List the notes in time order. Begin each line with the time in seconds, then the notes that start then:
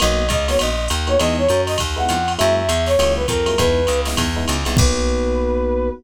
0.00 B1 A#3 B3 D#4 F#4 D#5, ride
0.29 C#2 D#5, kick, hi-hat pedal, ride
0.48 A#3 B3 D#4 F#4 C#5, snare, ride
0.59 A#1 D#5, ride
0.88 D#2, hi-hat pedal, ride
1.07 A#3 B3 D#4 F#4 C#5, ride
1.19 E2 G#3 B3 D#4 E4 D#5, ride
1.38 C#5
1.49 F#2, hi-hat pedal, ride
1.67 D#5, snare, ride
1.78 D#2, kick, ride
1.96 G#3 B3 D#4 E4 F#5
2.09 F2, hi-hat pedal, ride
2.28 ride
2.38 F#2 F#3 G#3 A#3 E4 E5, ride
2.57 E5
2.69 E2, hi-hat pedal, ride
2.86 C#5, snare, ride
2.98 C#2 F#3 G#3 A#3 E4, ride
3.16 B4
3.28 F2 A#4, kick, hi-hat pedal, ride
3.46 F#3 G#3 A#3 E4, ride
3.58 E2 G#3 B3 D#4 E4 B4, kick, ride
3.87 C#2, hi-hat pedal, ride
4.05 G#3 B3 D#4 E4, snare, ride
4.17 E2, kick, ride
4.36 G#3 B3 D#4 E4
4.48 C#2, hi-hat pedal, ride
4.65 C2 G#3 B3 D#4 E4, ride
4.77 B1 A#3 B3 D#4 F#4 B4, kick, crash